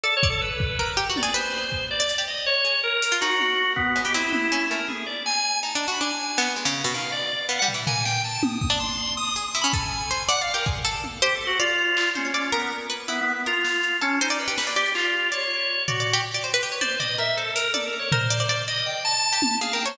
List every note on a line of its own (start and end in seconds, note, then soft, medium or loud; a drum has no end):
0.03 0.15 A4 loud
0.03 0.20 D5 medium
0.17 0.28 C#5 loud
0.23 0.40 D5 medium
0.23 kick loud
0.30 0.41 A4 loud
0.41 0.91 B4 medium
0.60 kick loud
0.79 0.96 A#4 medium
0.79 kick medium
0.97 1.08 G4 loud
1.10 1.21 F#4 medium
1.16 1.34 D5 medium
1.16 high tom medium
1.23 1.34 G#4 loud
1.34 1.85 B4 loud
1.34 1.85 C5 medium
1.34 cowbell soft
1.72 kick medium
1.91 2.24 D5 medium
2.00 2.08 D5 medium
2.09 closed hi-hat medium
2.18 2.27 G4 medium
2.28 2.45 D#5 medium
2.46 2.80 C#5 loud
2.65 2.90 G#4 medium
2.83 3.17 A#4 loud
3.02 closed hi-hat loud
3.12 3.20 F4 loud
3.21 3.72 D#4 medium
3.21 3.71 F#4 loud
3.21 cowbell medium
3.40 high tom medium
3.76 4.01 B3 loud
3.76 kick medium
3.96 4.04 G#3 medium
3.96 cowbell medium
4.05 4.13 B3 medium
4.05 4.14 G4 loud
4.14 4.48 C4 medium
4.14 4.65 E4 loud
4.33 high tom medium
4.52 4.69 C#4 medium
4.70 4.79 A3 medium
4.70 4.86 A#4 soft
4.88 5.05 G#4 soft
4.88 high tom medium
5.06 5.23 D5 medium
5.06 cowbell soft
5.26 5.59 G#5 loud
5.26 clap medium
5.63 5.74 D#4 medium
5.63 5.72 A5 soft
5.75 5.86 D4 medium
5.88 5.99 F#4 medium
5.88 6.00 B5 medium
6.01 6.34 D4 medium
6.01 6.51 G#5 medium
6.19 cowbell medium
6.38 6.55 B3 loud
6.38 clap loud
6.56 6.65 G#3 soft
6.65 6.82 C#3 medium
6.84 6.93 B2 medium
6.94 7.44 D#3 soft
6.94 7.11 F5 medium
7.12 7.46 D5 medium
7.49 7.60 B3 medium
7.49 7.58 F5 medium
7.59 7.73 G3 medium
7.59 7.67 F#5 loud
7.68 floor tom medium
7.74 7.85 E3 medium
7.87 8.38 A#3 medium
7.87 8.04 G#5 medium
7.87 floor tom loud
8.05 8.22 G5 loud
8.05 snare medium
8.24 8.41 A5 medium
8.43 8.60 D#6 medium
8.43 high tom loud
8.61 8.69 D#6 medium
8.61 kick medium
8.70 8.78 D4 loud
8.70 8.79 D6 medium
8.80 9.14 C6 medium
9.17 9.34 D#6 loud
9.36 9.44 G#4 medium
9.36 9.47 D#6 medium
9.48 9.59 D#6 medium
9.55 9.63 E4 medium
9.61 9.72 C#4 medium
9.61 9.73 B5 loud
9.73 10.07 A4 loud
9.73 10.23 G#5 medium
9.73 kick loud
10.11 10.27 C5 medium
10.29 10.40 D5 loud
10.29 10.40 F#5 loud
10.29 closed hi-hat loud
10.41 10.53 D5 medium
10.41 10.52 F5 loud
10.54 10.65 G4 medium
10.54 10.65 A#4 medium
10.66 10.83 G#4 medium
10.66 kick medium
10.85 11.18 A4 medium
11.04 high tom medium
11.22 11.34 G4 loud
11.22 11.56 C5 loud
11.35 11.46 A4 medium
11.47 11.58 F#4 loud
11.59 12.10 F4 loud
11.59 12.10 D5 loud
11.97 clap loud
12.15 12.50 C#4 medium
12.15 12.24 C5 medium
12.15 high tom medium
12.25 12.33 C#5 soft
12.34 12.51 D5 medium
12.52 12.69 B3 medium
12.52 12.86 A#4 loud
12.52 cowbell medium
12.90 13.06 B4 medium
13.08 13.20 B3 medium
13.08 13.42 E4 medium
13.21 13.32 B3 loud
13.34 13.45 B3 medium
13.46 13.97 F4 medium
13.46 13.97 A#4 medium
13.65 snare medium
13.83 closed hi-hat medium
14.01 14.19 C#4 loud
14.01 14.18 A4 medium
14.21 14.38 D#4 medium
14.21 14.30 C5 loud
14.30 14.39 D5 loud
14.39 14.73 B4 medium
14.48 14.56 G4 medium
14.58 14.66 B4 medium
14.58 snare medium
14.67 14.75 D5 medium
14.76 14.93 G4 loud
14.76 14.85 D5 medium
14.86 15.28 D5 medium
14.95 15.29 F4 loud
14.95 clap medium
15.32 15.83 C#5 medium
15.32 15.82 D5 medium
15.88 16.22 F#4 medium
15.88 15.99 D5 medium
15.88 floor tom medium
16.00 16.11 D5 medium
16.13 16.25 G4 loud
16.34 16.43 D5 medium
16.44 16.52 C5 medium
16.54 16.62 B4 loud
16.63 16.71 G4 medium
16.72 16.80 C#5 medium
16.81 16.98 C5 medium
16.81 16.98 D5 medium
16.81 high tom medium
16.99 17.17 D5 medium
16.99 17.16 D#5 medium
16.99 floor tom medium
17.18 17.35 A#4 medium
17.18 17.36 E5 medium
17.37 17.54 A4 medium
17.37 17.71 C5 medium
17.55 17.72 A#4 medium
17.55 closed hi-hat loud
17.74 17.85 A4 medium
17.74 18.07 D5 medium
17.74 high tom medium
17.86 17.97 A#4 medium
17.99 18.10 C#5 medium
18.12 18.29 A#4 loud
18.12 18.62 C5 medium
18.12 floor tom loud
18.30 18.39 D5 loud
18.40 18.48 D5 loud
18.49 18.66 D5 loud
18.68 19.01 D5 medium
18.68 18.84 D#5 medium
18.86 19.03 G5 medium
19.05 19.55 A5 loud
19.33 19.41 G4 medium
19.42 high tom loud
19.61 19.73 G#4 medium
19.61 19.72 F5 medium
19.73 19.84 A#4 medium
19.73 19.85 G5 medium
19.85 19.96 C5 medium
19.85 19.97 C#5 medium